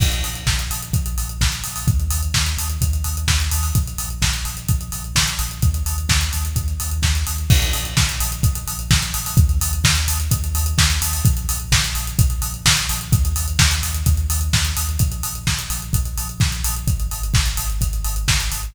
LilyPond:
<<
  \new Staff \with { instrumentName = "Synth Bass 2" } { \clef bass \time 4/4 \key bes \minor \tempo 4 = 128 bes,,8 bes,,8 bes,,8 bes,,8 bes,,8 bes,,8 bes,,8 bes,,8 | ees,8 ees,8 ees,8 ees,8 ees,8 ees,8 ees,8 ees,8 | bes,,8 bes,,8 bes,,8 bes,,8 bes,,8 bes,,8 bes,,8 bes,,8 | ees,8 ees,8 ees,8 ees,8 ees,8 ees,8 ees,8 ees,8 |
bes,,8 bes,,8 bes,,8 bes,,8 bes,,8 bes,,8 bes,,8 bes,,8 | ees,8 ees,8 ees,8 ees,8 ees,8 ees,8 ees,8 ees,8 | bes,,8 bes,,8 bes,,8 bes,,8 bes,,8 bes,,8 bes,,8 bes,,8 | ees,8 ees,8 ees,8 ees,8 ees,8 ees,8 ees,8 ees,8 |
bes,,8 bes,,8 bes,,8 bes,,8 bes,,8 bes,,8 bes,,8 bes,,8 | aes,,8 aes,,8 aes,,8 aes,,8 aes,,8 aes,,8 aes,,8 aes,,8 | }
  \new DrumStaff \with { instrumentName = "Drums" } \drummode { \time 4/4 <cymc bd>16 hh16 hho16 hh16 <bd sn>16 hh16 hho16 hh16 <hh bd>16 hh16 hho16 hh16 <bd sn>16 hh16 hho16 hho16 | <hh bd>16 hh16 hho16 hh16 <bd sn>16 hh16 hho16 hh16 <hh bd>16 hh16 hho16 hh16 <bd sn>16 hh16 hho16 hho16 | <hh bd>16 hh16 hho16 hh16 <bd sn>16 hh16 hho16 hh16 <hh bd>16 hh16 hho16 hh16 <bd sn>16 hh16 hho16 hh16 | <hh bd>16 hh16 hho16 hh16 <bd sn>16 hh16 hho16 hh16 <hh bd>16 hh16 hho16 hh16 <bd sn>16 hh16 hho16 hh16 |
<cymc bd>16 hh16 hho16 hh16 <bd sn>16 hh16 hho16 hh16 <hh bd>16 hh16 hho16 hh16 <bd sn>16 hh16 hho16 hho16 | <hh bd>16 hh16 hho16 hh16 <bd sn>16 hh16 hho16 hh16 <hh bd>16 hh16 hho16 hh16 <bd sn>16 hh16 hho16 hho16 | <hh bd>16 hh16 hho16 hh16 <bd sn>16 hh16 hho16 hh16 <hh bd>16 hh16 hho16 hh16 <bd sn>16 hh16 hho16 hh16 | <hh bd>16 hh16 hho16 hh16 <bd sn>16 hh16 hho16 hh16 <hh bd>16 hh16 hho16 hh16 <bd sn>16 hh16 hho16 hh16 |
<hh bd>16 hh16 hho16 hh16 <bd sn>16 hh16 hho16 hh16 <hh bd>16 hh16 hho16 hh16 <bd sn>16 hh16 hho16 hh16 | <hh bd>16 hh16 hho16 hh16 <bd sn>16 hh16 hho16 hh16 <hh bd>16 hh16 hho16 hh16 <bd sn>16 hh16 hho16 hh16 | }
>>